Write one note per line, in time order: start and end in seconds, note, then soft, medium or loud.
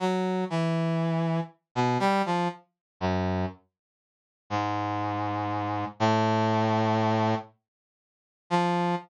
0.00 0.44 F#3 medium
0.50 1.40 E3 medium
1.75 1.98 B2 medium
2.00 2.22 G3 loud
2.26 2.48 F3 medium
3.00 3.45 F#2 medium
4.50 5.85 G#2 medium
6.00 7.35 A2 loud
8.50 8.95 F3 medium